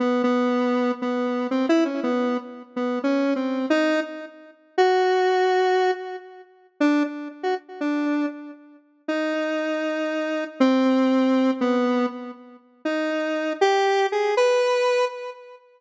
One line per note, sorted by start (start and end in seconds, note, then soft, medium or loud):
0.00 0.22 B3 medium
0.24 0.92 B3 medium
1.02 1.47 B3 medium
1.51 1.66 C4 medium
1.69 1.84 E4 loud
1.85 2.00 C#4 medium
2.03 2.37 B3 medium
2.76 2.99 B3 medium
3.04 3.34 C#4 medium
3.36 3.66 C4 soft
3.70 4.00 D#4 loud
4.78 5.91 F#4 loud
6.80 7.03 D4 medium
7.43 7.55 F#4 medium
7.81 8.26 D4 medium
9.08 10.44 D#4 medium
10.60 11.51 C4 loud
11.61 12.06 B3 medium
12.85 13.53 D#4 medium
13.61 14.07 G4 loud
14.12 14.35 G#4 medium
14.37 15.05 B4 loud